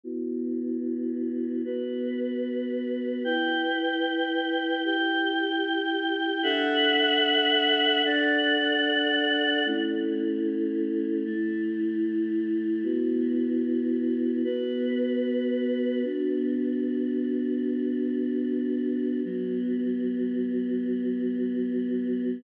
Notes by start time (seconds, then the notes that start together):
0.04 B3 E4 F#4
1.65 B3 F#4 B4
3.25 E4 B4 G5
4.85 E4 G4 G5
6.43 D4 A4 E5 F#5
8.05 D4 A4 D5 F#5
9.65 A3 C#4 E4
11.25 A3 E4 A4
12.84 B3 E4 F#4
14.44 B3 F#4 B4
16.04 B3 D4 F#4
19.24 F#3 B3 F#4